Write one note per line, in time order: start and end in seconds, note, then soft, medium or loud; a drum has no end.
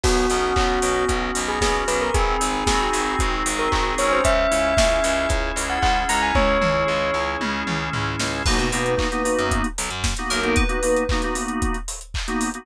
0.04 0.26 B1 medium
0.04 1.09 B3 medium
0.04 0.53 F#4 loud
0.04 kick medium
0.04 crash medium
0.30 0.53 B1 medium
0.30 0.82 C#4 medium
0.30 open hi-hat medium
0.56 0.79 B1 medium
0.56 1.60 F#4 medium
0.56 1.04 F#4 loud
0.56 kick medium
0.56 clap medium
0.82 1.05 B1 medium
0.82 1.34 C#4 medium
0.82 open hi-hat medium
1.09 1.31 B1 medium
1.09 2.10 B3 medium
1.09 kick medium
1.09 closed hi-hat medium
1.35 1.59 B1 medium
1.35 1.86 C#4 medium
1.35 open hi-hat medium
1.48 1.61 G#4 medium
1.60 1.84 B1 medium
1.60 2.10 F#4 medium
1.60 1.74 G#4 loud
1.60 kick medium
1.60 snare medium
1.87 2.10 B1 medium
1.87 2.12 C#4 medium
1.87 2.00 B4 medium
1.87 open hi-hat medium
2.01 2.14 A#4 medium
2.14 2.37 G#1 loud
2.14 3.74 C4 medium
2.14 2.63 G#4 loud
2.14 kick medium
2.14 closed hi-hat medium
2.40 2.64 G#1 loud
2.40 3.45 D#4 medium
2.40 open hi-hat medium
2.67 2.89 G#1 loud
2.67 3.19 F#4 medium
2.67 3.15 G#4 loud
2.67 kick medium
2.67 snare medium
2.92 3.15 G#1 medium
2.92 4.17 G#4 medium
2.92 open hi-hat medium
3.19 3.43 G#1 medium
3.19 4.20 F#4 medium
3.19 kick medium
3.19 closed hi-hat medium
3.46 3.68 G#1 medium
3.46 4.21 D#4 medium
3.46 open hi-hat medium
3.59 3.71 A#4 loud
3.72 3.95 G#1 medium
3.72 4.24 C4 medium
3.72 3.85 A#4 medium
3.72 kick medium
3.72 clap medium
3.98 4.21 G#1 medium
3.98 5.29 C#4 medium
3.98 4.11 C#5 loud
3.98 open hi-hat medium
4.12 4.24 C5 medium
4.24 4.46 C#2 medium
4.24 4.75 E5 loud
4.24 kick medium
4.24 closed hi-hat medium
4.50 4.74 C#2 medium
4.50 5.02 E4 medium
4.50 open hi-hat medium
4.76 5.00 C#2 medium
4.76 5.84 G#4 medium
4.76 5.26 E5 medium
4.76 kick medium
4.76 snare medium
5.03 5.26 C#2 medium
5.03 5.55 E4 medium
5.03 open hi-hat medium
5.29 5.52 C#2 medium
5.29 6.35 C#4 medium
5.29 kick medium
5.29 closed hi-hat medium
5.56 5.78 C#2 medium
5.56 6.10 E4 medium
5.56 open hi-hat medium
5.69 5.82 F#5 medium
5.82 6.05 C#2 medium
5.82 6.86 G#4 medium
5.82 5.95 F#5 loud
5.82 kick medium
5.82 clap medium
6.09 6.32 C#2 medium
6.09 6.59 E4 medium
6.09 6.22 A#5 loud
6.09 open hi-hat medium
6.22 6.35 G#5 medium
6.35 6.58 C#2 medium
6.35 7.42 C#4 medium
6.35 7.21 C#5 loud
6.35 kick medium
6.35 high tom medium
6.60 6.84 C#2 medium
6.60 7.15 E4 medium
6.60 mid tom medium
6.87 7.11 C#2 medium
6.87 7.92 G#4 medium
7.14 7.36 C#2 medium
7.14 7.67 E4 medium
7.41 7.63 C#2 medium
7.41 8.42 C#4 medium
7.41 high tom medium
7.67 7.89 C#2 medium
7.67 8.19 E4 medium
7.67 mid tom medium
7.93 8.16 C#2 medium
7.93 8.43 G#4 medium
7.93 floor tom medium
8.19 8.42 C#2 medium
8.19 8.44 E4 medium
8.19 snare medium
8.46 8.58 B1 loud
8.46 8.58 A#3 medium
8.46 8.58 B3 medium
8.46 8.58 D#4 medium
8.46 8.58 F#4 medium
8.46 9.46 B4 medium
8.46 kick medium
8.46 crash medium
8.58 8.71 B2 loud
8.58 8.69 A#3 medium
8.58 8.69 B3 medium
8.58 8.69 D#4 medium
8.58 8.69 F#4 medium
8.58 closed hi-hat soft
8.72 8.96 B2 medium
8.72 8.94 A#3 medium
8.72 8.94 B3 medium
8.72 8.94 D#4 medium
8.72 8.94 F#4 medium
8.72 open hi-hat medium
8.86 closed hi-hat medium
8.97 9.08 A#3 medium
8.97 9.08 B3 medium
8.97 9.08 D#4 medium
8.97 9.08 F#4 medium
8.97 kick medium
8.97 clap medium
9.12 9.22 A#3 medium
9.12 9.22 B3 medium
9.12 9.22 D#4 medium
9.12 9.22 F#4 medium
9.12 closed hi-hat medium
9.24 9.66 A#3 medium
9.24 9.66 B3 medium
9.24 9.66 D#4 medium
9.24 9.66 F#4 medium
9.24 open hi-hat medium
9.38 9.62 F#2 medium
9.38 closed hi-hat medium
9.51 kick medium
9.51 closed hi-hat medium
9.64 closed hi-hat medium
9.78 9.90 B1 medium
9.78 open hi-hat medium
9.90 10.14 F#2 medium
9.90 closed hi-hat medium
10.04 kick medium
10.04 snare medium
10.17 10.40 A#3 medium
10.17 10.40 B3 medium
10.17 10.40 D#4 medium
10.17 10.40 F#4 medium
10.17 closed hi-hat medium
10.30 10.55 B1 medium
10.30 10.56 A#4 medium
10.30 open hi-hat medium
10.42 10.63 A#3 medium
10.42 10.63 B3 medium
10.42 10.63 D#4 medium
10.42 10.63 F#4 medium
10.42 closed hi-hat soft
10.56 11.31 B4 medium
10.56 kick medium
10.56 closed hi-hat medium
10.69 10.79 A#3 medium
10.69 10.79 B3 medium
10.69 10.79 D#4 medium
10.69 10.79 F#4 medium
10.69 closed hi-hat medium
10.83 11.04 A#3 medium
10.83 11.04 B3 medium
10.83 11.04 D#4 medium
10.83 11.04 F#4 medium
10.83 open hi-hat medium
10.96 closed hi-hat medium
11.09 11.21 A#3 medium
11.09 11.21 B3 medium
11.09 11.21 D#4 medium
11.09 11.21 F#4 medium
11.09 kick medium
11.09 clap medium
11.22 11.34 A#3 medium
11.22 11.34 B3 medium
11.22 11.34 D#4 medium
11.22 11.34 F#4 medium
11.22 closed hi-hat medium
11.35 11.77 A#3 medium
11.35 11.77 B3 medium
11.35 11.77 D#4 medium
11.35 11.77 F#4 medium
11.35 open hi-hat medium
11.48 closed hi-hat medium
11.62 kick medium
11.62 closed hi-hat medium
11.74 closed hi-hat soft
11.88 open hi-hat medium
12.01 closed hi-hat medium
12.14 kick medium
12.14 clap medium
12.28 12.49 A#3 medium
12.28 12.49 B3 medium
12.28 12.49 D#4 medium
12.28 12.49 F#4 medium
12.28 closed hi-hat medium
12.41 open hi-hat medium
12.54 12.65 A#3 medium
12.54 12.65 B3 medium
12.54 12.65 D#4 medium
12.54 12.65 F#4 medium
12.54 closed hi-hat medium